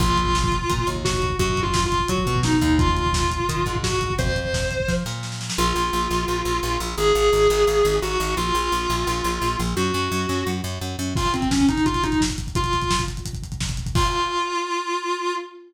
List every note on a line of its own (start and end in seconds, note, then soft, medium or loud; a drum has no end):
0.00 0.59 A#1 loud
0.00 0.87 F4 medium
0.00 kick medium
0.00 crash medium
0.10 kick medium
0.17 kick medium
0.17 closed hi-hat medium
0.26 kick medium
0.35 kick medium
0.35 snare medium
0.44 kick medium
0.52 kick medium
0.52 closed hi-hat medium
0.62 kick medium
0.70 0.85 A#2 medium
0.70 kick medium
0.70 closed hi-hat medium
0.78 kick medium
0.87 1.32 D#2 medium
0.87 kick medium
0.87 closed hi-hat medium
0.96 kick medium
1.05 1.34 F#4 medium
1.05 kick medium
1.05 snare loud
1.14 kick medium
1.22 kick medium
1.22 closed hi-hat medium
1.30 kick medium
1.39 1.99 F#2 loud
1.39 1.59 F#4 medium
1.39 kick medium
1.39 closed hi-hat medium
1.49 kick medium
1.57 kick medium
1.57 closed hi-hat medium
1.63 1.82 F4 medium
1.63 kick medium
1.74 kick medium
1.74 snare loud
1.84 2.07 F4 medium
1.84 kick medium
1.92 kick medium
1.92 closed hi-hat medium
2.00 kick medium
2.08 2.24 F#3 medium
2.08 2.39 F#4 medium
2.08 kick medium
2.08 closed hi-hat medium
2.18 kick medium
2.26 2.60 B2 medium
2.26 kick medium
2.26 closed hi-hat medium
2.36 kick medium
2.43 2.77 D#4 medium
2.43 kick medium
2.43 snare medium
2.53 kick medium
2.61 3.38 D#2 loud
2.61 kick medium
2.61 closed hi-hat medium
2.70 kick medium
2.79 3.74 F4 medium
2.79 kick loud
2.79 closed hi-hat medium
2.88 kick medium
2.97 kick medium
2.97 closed hi-hat medium
3.06 kick medium
3.13 kick medium
3.13 snare loud
3.23 kick medium
3.31 kick medium
3.31 closed hi-hat medium
3.40 kick medium
3.49 3.64 D#3 medium
3.49 kick medium
3.49 closed hi-hat loud
3.57 kick medium
3.66 4.11 G#2 medium
3.66 kick medium
3.66 closed hi-hat medium
3.75 kick medium
3.83 4.12 F#4 medium
3.83 kick medium
3.83 snare loud
3.92 kick medium
4.01 kick medium
4.01 closed hi-hat medium
4.10 kick medium
4.18 4.78 F2 medium
4.18 4.90 C5 medium
4.18 kick medium
4.18 closed hi-hat medium
4.26 kick medium
4.36 kick medium
4.36 closed hi-hat medium
4.45 kick medium
4.54 kick medium
4.54 snare medium
4.62 kick medium
4.71 kick medium
4.71 closed hi-hat medium
4.80 kick medium
4.88 5.03 F3 medium
4.88 kick medium
4.88 snare medium
5.06 5.50 A#2 medium
5.06 snare medium
5.23 snare medium
5.32 snare medium
5.41 snare medium
5.50 snare medium
5.58 5.73 A#1 loud
5.58 6.79 F4 medium
5.76 5.90 A#1 medium
5.93 6.08 A#1 medium
6.11 6.25 A#1 medium
6.28 6.43 A#1 medium
6.45 6.60 A#1 medium
6.63 6.78 A#1 medium
6.80 6.95 A#1 loud
6.97 7.12 G#1 loud
6.97 7.94 G#4 medium
7.15 7.30 G#1 medium
7.33 7.47 G#1 medium
7.50 7.65 G#1 loud
7.67 7.82 G#1 medium
7.85 8.00 G#1 medium
8.02 8.17 G#1 medium
8.02 8.33 F#4 medium
8.20 8.35 G#1 medium
8.37 8.52 A#1 medium
8.37 9.57 F4 medium
8.55 8.69 A#1 medium
8.72 8.87 A#1 medium
8.90 9.05 A#1 medium
9.07 9.22 A#1 medium
9.24 9.39 A#1 medium
9.42 9.56 A#1 medium
9.59 9.74 A#1 medium
9.77 9.91 F#2 loud
9.77 10.47 F#4 medium
9.94 10.09 F#2 medium
10.12 10.26 F#2 loud
10.29 10.44 F#2 medium
10.47 10.61 F#2 medium
10.64 10.79 F#2 medium
10.81 10.96 F#2 medium
10.99 11.14 F#2 medium
11.15 11.32 F4 medium
11.15 kick medium
11.15 crash loud
11.25 kick medium
11.25 closed hi-hat medium
11.34 11.49 C4 medium
11.34 kick medium
11.34 closed hi-hat medium
11.42 kick medium
11.42 closed hi-hat medium
11.51 11.66 C#4 medium
11.51 kick medium
11.51 snare loud
11.60 kick medium
11.60 closed hi-hat soft
11.69 11.83 D#4 medium
11.69 kick medium
11.69 closed hi-hat medium
11.77 kick medium
11.77 closed hi-hat medium
11.86 12.02 F4 medium
11.86 kick medium
11.86 closed hi-hat medium
11.94 kick medium
11.94 closed hi-hat medium
12.03 12.18 D#4 medium
12.03 kick medium
12.03 closed hi-hat medium
12.12 kick medium
12.12 closed hi-hat medium
12.21 kick medium
12.21 snare loud
12.30 kick medium
12.30 closed hi-hat medium
12.38 kick medium
12.38 closed hi-hat medium
12.47 kick medium
12.47 closed hi-hat medium
12.55 13.01 F4 medium
12.55 kick medium
12.55 closed hi-hat medium
12.64 kick medium
12.64 closed hi-hat medium
12.73 kick medium
12.73 closed hi-hat medium
12.82 kick medium
12.82 closed hi-hat medium
12.91 kick medium
12.91 snare loud
12.99 kick medium
12.99 closed hi-hat medium
13.08 kick medium
13.08 closed hi-hat medium
13.17 kick medium
13.17 closed hi-hat medium
13.25 kick medium
13.25 closed hi-hat medium
13.33 kick medium
13.33 closed hi-hat medium
13.43 kick medium
13.43 closed hi-hat medium
13.52 kick medium
13.52 closed hi-hat medium
13.60 kick medium
13.60 snare medium
13.69 kick medium
13.69 closed hi-hat medium
13.77 kick medium
13.77 closed hi-hat medium
13.86 kick medium
13.86 closed hi-hat medium
13.95 15.35 F4 loud
13.95 kick loud
13.95 crash loud